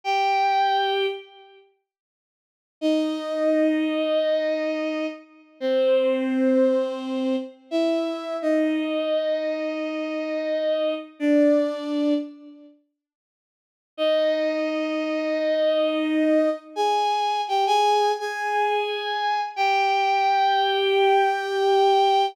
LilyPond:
\new Staff { \time 4/4 \key c \minor \tempo 4 = 86 <g' g''>4. r2 r8 | <ees' ees''>1 | <c' c''>2. <e' e''>4 | <ees' ees''>1 |
<d' d''>4. r2 r8 | <ees' ees''>1 | <aes' aes''>4 <g' g''>16 <aes' aes''>8. <aes' aes''>2 | <g' g''>1 | }